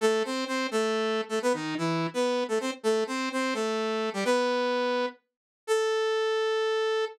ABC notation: X:1
M:12/8
L:1/8
Q:3/8=169
K:A
V:1 name="Lead 2 (sawtooth)"
[A,A]2 [=C=c]2 [Cc]2 [A,A]5 [A,A] | [B,B] [^D,^D]2 [E,E]3 [B,B]3 [A,A] [=C=c] z | [A,A]2 [=C=c]2 [Cc]2 [A,A]5 [=G,=G] | [B,B]7 z5 |
A12 |]